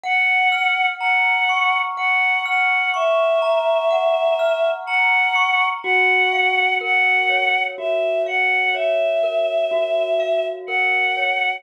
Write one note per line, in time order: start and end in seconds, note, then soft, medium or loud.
0.04 1.97 F#5 medium
0.04 0.87 F#5 medium
0.52 2.45 F6 medium
0.99 1.79 F#5 medium
0.99 3.42 A#5 medium
1.49 2.93 C#6 medium
1.97 2.43 F#5 medium
1.97 3.90 F#5 medium
2.46 2.90 F#5 medium
2.46 4.39 F6 medium
2.94 4.69 E5 medium
2.94 5.35 C#6 medium
3.42 4.87 A#5 medium
3.91 5.74 F#5 medium
4.39 5.77 F6 medium
4.86 5.66 F#5 medium
4.86 5.79 A#5 medium
5.35 5.81 C#6 medium
5.83 7.78 F#4 medium
5.83 6.75 F#5 medium
6.33 8.26 F5 medium
6.81 9.23 A#4 medium
6.81 7.62 F#5 medium
7.30 8.74 C#5 medium
7.78 9.71 F#4 medium
7.78 8.22 E5 medium
8.26 10.19 F5 medium
8.26 8.73 F#5 medium
8.74 11.16 C#5 medium
8.74 10.45 E5 medium
9.23 10.68 A#4 medium
9.71 11.55 F#4 medium
10.20 11.58 F5 medium
10.67 11.60 A#4 medium
10.67 11.55 F#5 medium
11.17 11.63 C#5 medium